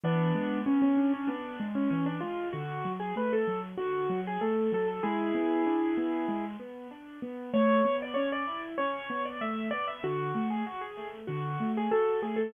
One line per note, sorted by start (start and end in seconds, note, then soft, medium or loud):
0.04 0.32 E3 medium
0.04 0.60 B3 loud
0.04 0.60 D4 loud
0.35 0.63 G#3 medium
0.66 0.94 B3 medium
0.66 0.81 C#4 medium
0.82 1.12 C#4 medium
0.97 1.25 D4 medium
1.14 1.29 C#4 loud
1.27 1.56 B3 medium
1.27 1.65 D4 medium
1.60 1.88 G#3 medium
1.75 1.90 C#4 medium
1.90 2.19 E3 medium
1.90 2.05 C#4 loud
2.06 2.21 D4 medium
2.21 2.51 G#3 medium
2.21 2.48 F4 medium
2.53 2.82 D3 medium
2.53 2.92 F#4 loud
2.85 3.13 F#3 medium
3.00 3.15 G#4 medium
3.16 3.44 A3 medium
3.16 3.32 B4 medium
3.33 3.60 A4 loud
3.47 3.76 F#3 medium
3.77 4.07 D3 medium
3.77 4.20 F#4 loud
4.10 4.38 F#3 medium
4.27 4.42 G#4 loud
4.41 4.69 A3 medium
4.41 4.71 A4 medium
4.72 5.00 F#3 medium
4.72 4.87 A4 loud
4.88 5.03 A4 medium
5.03 5.32 G#3 medium
5.03 6.45 E4 medium
5.03 6.45 G#4 loud
5.35 5.63 B3 medium
5.66 5.94 D4 medium
5.97 6.26 B3 medium
6.28 6.57 G#3 medium
6.60 6.88 B3 medium
6.91 7.19 D4 medium
7.22 7.50 B3 medium
7.54 7.82 A3 loud
7.54 7.96 C#5 loud
7.85 8.13 B3 medium
8.02 8.17 D5 loud
8.14 8.44 C#4 medium
8.14 8.29 C#5 loud
8.32 8.61 D5 loud
8.47 8.76 E4 medium
8.78 9.07 C#4 medium
8.78 9.23 C#5 loud
9.10 9.38 B3 medium
9.25 9.40 D5 medium
9.41 9.69 A3 medium
9.41 9.67 E5 medium
9.71 10.00 B3 medium
9.71 9.86 D5 loud
9.88 10.02 E5 medium
10.03 10.32 D3 medium
10.03 10.49 F#4 loud
10.35 10.63 A3 medium
10.50 10.65 G#4 medium
10.67 10.81 F#4 loud
10.81 11.07 G#4 medium
10.97 11.25 A3 medium
11.27 11.57 D3 medium
11.27 11.71 F#4 medium
11.60 11.88 A3 medium
11.77 11.92 G#4 loud
11.91 12.19 F#4 medium
11.91 12.20 A4 loud
12.22 12.50 A3 medium
12.22 12.37 G#4 medium
12.36 12.51 A4 loud